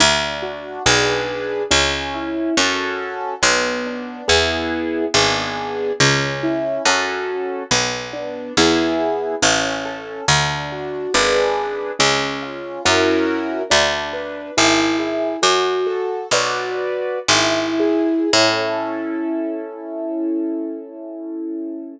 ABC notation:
X:1
M:3/4
L:1/8
Q:1/4=70
K:A
V:1 name="Acoustic Grand Piano"
D F [DGB]2 C E | [CFA]2 B, D [B,EG]2 | [B,DG]2 C E [CFA]2 | B, D [B,EG]2 C A |
D F [DGB]2 C ^E | [CEF^A]2 D B E G | "^rit." F A [FBd]2 E G | [CEA]6 |]
V:2 name="Harpsichord" clef=bass
D,,2 B,,,2 C,,2 | F,,2 B,,,2 E,,2 | G,,,2 C,,2 F,,2 | B,,,2 E,,2 A,,,2 |
D,,2 G,,,2 C,,2 | F,,2 D,,2 G,,,2 | "^rit." F,,2 B,,,2 G,,,2 | A,,6 |]